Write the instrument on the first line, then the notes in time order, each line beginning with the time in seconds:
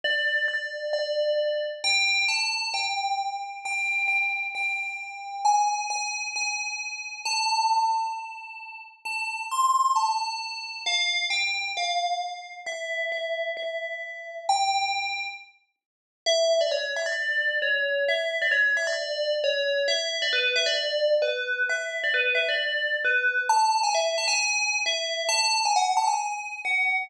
tubular bells
0.04 D5
0.48 D5
0.93 D5
1.84 G5
2.28 A5
2.74 G5
3.65 G5
4.08 G5
4.55 G5
5.45 G#5
5.90 G#5
6.36 G#5
7.25 A5
9.05 A5
9.51 C6
9.96 A5
10.86 F5
11.30 G5
11.77 F5
12.66 E5
13.12 E5
13.57 E5
14.49 G5
16.26 E5
16.61 D5
16.71 C#5
16.96 E5
17.06 D5
17.62 C#5
18.08 E5
18.42 D5
18.51 C#5
18.77 E5
18.87 D5
19.44 C#5
19.88 E5
20.22 D5
20.33 B4
20.56 E5
20.66 D5
21.22 B4
21.69 E5
22.04 D5
22.14 B4
22.35 E5
22.49 D5
23.05 B4
23.49 A5
23.83 G#5
23.95 E5
24.18 A5
24.28 G#5
24.86 E5
25.29 A5
25.65 G#5
25.76 F#5
25.97 A5
26.07 G#5
26.65 F#5